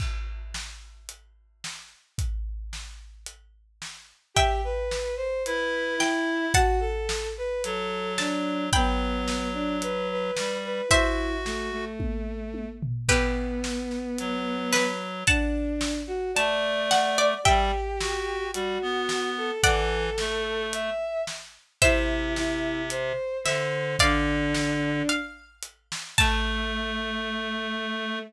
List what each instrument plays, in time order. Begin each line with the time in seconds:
0.00 kick, crash
0.54 snare
1.09 closed hi-hat
1.64 snare
2.18 kick, closed hi-hat
2.73 snare
3.26 closed hi-hat
3.82 snare
4.34 violin G4, harpsichord E5 G5, kick, closed hi-hat
4.64 violin B4
4.91 snare
5.17 violin C5
5.45 clarinet E4, violin B4, closed hi-hat
5.98 violin E4, harpsichord G5, snare
6.54 violin F#4, harpsichord F#5 A5, kick, closed hi-hat
6.80 violin A4
7.09 snare
7.38 violin B4
7.64 clarinet F#3, violin A4, closed hi-hat
8.18 violin D4, harpsichord A5, snare
8.72 clarinet F#3, violin B3, harpsichord G5 B5, kick, closed hi-hat
9.28 snare
9.54 violin D4
9.82 violin B4, closed hi-hat
10.11 violin B4
10.37 clarinet G3, snare
10.65 violin B4
10.89 violin E4, clarinet F#4, harpsichord C5 E5, kick, closed hi-hat
11.45 violin A3, snare
11.72 violin A3
11.99 kick, high tom
12.54 high tom
12.83 floor tom
13.08 violin B3, harpsichord G4 B4, kick, crash
13.64 snare
13.91 snare
14.18 clarinet F#3, closed hi-hat
14.73 harpsichord B4, snare
15.27 violin D4, harpsichord F#5 A5, kick, closed hi-hat
15.81 snare
16.07 violin F#4
16.34 clarinet A3, violin D5, harpsichord A5, closed hi-hat
16.91 harpsichord F#5, snare
17.18 harpsichord D5
17.44 clarinet G3, violin G4, harpsichord E5 G5, kick, closed hi-hat
18.00 clarinet F#4, snare
18.53 clarinet G3, violin F#4, closed hi-hat
18.82 clarinet B3
19.09 snare
19.37 violin A4
19.62 clarinet E3, violin A4, harpsichord D5 F#5, kick, closed hi-hat
20.18 clarinet A3, snare
20.73 violin E5, closed hi-hat
21.27 snare
21.81 clarinet C3, violin E4, harpsichord C5 E5, kick, closed hi-hat
22.36 violin E4, snare
22.90 violin C5, closed hi-hat
23.44 clarinet D3, violin C5, harpsichord E5, snare
23.99 clarinet D3, violin D4, harpsichord D5 F5, kick, closed hi-hat
24.54 snare
25.09 harpsichord F5, closed hi-hat
25.63 closed hi-hat
25.92 snare
26.17 clarinet A3, violin A3, harpsichord A5, kick, crash